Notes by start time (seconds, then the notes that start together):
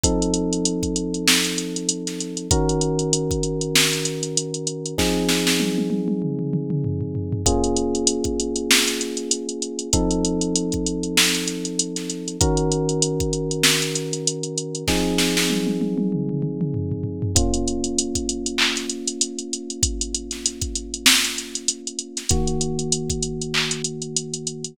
0.03 F3 C4 D#4 A4, kick, closed hi-hat
0.22 closed hi-hat
0.34 closed hi-hat
0.53 closed hi-hat
0.65 closed hi-hat
0.83 kick, closed hi-hat
0.96 closed hi-hat
1.14 closed hi-hat
1.28 snare
1.44 closed hi-hat
1.58 closed hi-hat
1.76 closed hi-hat
1.89 closed hi-hat
2.07 snare, closed hi-hat
2.20 closed hi-hat
2.37 closed hi-hat
2.51 D#3 C#4 F#4 A#4, kick, closed hi-hat
2.69 closed hi-hat
2.81 closed hi-hat
2.99 closed hi-hat
3.13 closed hi-hat
3.31 kick, closed hi-hat
3.43 closed hi-hat
3.61 closed hi-hat
3.76 snare
3.93 closed hi-hat
4.05 closed hi-hat
4.23 closed hi-hat
4.37 closed hi-hat
4.54 closed hi-hat
4.67 closed hi-hat
4.86 closed hi-hat
4.98 F3 C4 D#4 G#4, kick, snare
5.29 snare
5.47 snare
5.60 high tom
5.78 high tom
5.90 high tom
6.08 high tom
6.22 mid tom
6.39 mid tom
6.53 mid tom
6.70 mid tom
6.84 floor tom
7.01 floor tom
7.15 floor tom
7.32 floor tom
7.46 A#3 C#4 F4 G#4, kick, closed hi-hat
7.64 closed hi-hat
7.77 closed hi-hat
7.95 closed hi-hat
8.07 closed hi-hat
8.24 kick, closed hi-hat
8.40 closed hi-hat
8.56 closed hi-hat
8.71 snare
8.88 closed hi-hat
9.01 closed hi-hat
9.17 closed hi-hat
9.31 closed hi-hat
9.49 closed hi-hat
9.62 closed hi-hat
9.79 closed hi-hat
9.93 F3 C4 D#4 A4, kick, closed hi-hat
10.11 closed hi-hat
10.25 closed hi-hat
10.41 closed hi-hat
10.56 closed hi-hat
10.72 kick, closed hi-hat
10.86 closed hi-hat
11.03 closed hi-hat
11.17 snare
11.35 closed hi-hat
11.48 closed hi-hat
11.65 closed hi-hat
11.79 closed hi-hat
11.96 snare, closed hi-hat
12.10 closed hi-hat
12.28 closed hi-hat
12.41 D#3 C#4 F#4 A#4, kick, closed hi-hat
12.57 closed hi-hat
12.72 closed hi-hat
12.89 closed hi-hat
13.02 closed hi-hat
13.20 kick, closed hi-hat
13.33 closed hi-hat
13.51 closed hi-hat
13.64 snare
13.82 closed hi-hat
13.95 closed hi-hat
14.13 closed hi-hat
14.27 closed hi-hat
14.43 closed hi-hat
14.58 closed hi-hat
14.75 closed hi-hat
14.88 F3 C4 D#4 G#4, kick, snare
15.18 snare
15.37 snare
15.50 high tom
15.67 high tom
15.81 high tom
15.98 high tom
16.12 mid tom
16.29 mid tom
16.42 mid tom
16.61 mid tom
16.74 floor tom
16.92 floor tom
17.04 floor tom
17.22 floor tom
17.35 A#3 C#4 F4, kick, closed hi-hat
17.54 closed hi-hat
17.68 closed hi-hat
17.84 closed hi-hat
17.98 closed hi-hat
18.15 kick, closed hi-hat
18.29 closed hi-hat
18.46 closed hi-hat
18.58 clap
18.76 snare, closed hi-hat
18.90 closed hi-hat
19.07 closed hi-hat
19.21 closed hi-hat
19.39 closed hi-hat
19.53 closed hi-hat
19.70 closed hi-hat
19.83 kick, closed hi-hat
20.01 closed hi-hat
20.15 closed hi-hat
20.31 snare, closed hi-hat
20.46 closed hi-hat
20.61 kick, closed hi-hat
20.76 closed hi-hat
20.94 closed hi-hat
21.06 snare
21.24 closed hi-hat
21.38 closed hi-hat
21.55 closed hi-hat
21.68 closed hi-hat
21.87 closed hi-hat
21.99 closed hi-hat
22.17 snare, closed hi-hat
22.29 D#3 A#3 F#4, kick, closed hi-hat
22.47 closed hi-hat
22.61 closed hi-hat
22.79 closed hi-hat
22.92 closed hi-hat
23.10 kick, closed hi-hat
23.23 closed hi-hat
23.41 closed hi-hat
23.54 clap
23.71 closed hi-hat
23.84 closed hi-hat
24.02 closed hi-hat
24.16 closed hi-hat
24.34 closed hi-hat
24.47 closed hi-hat
24.64 closed hi-hat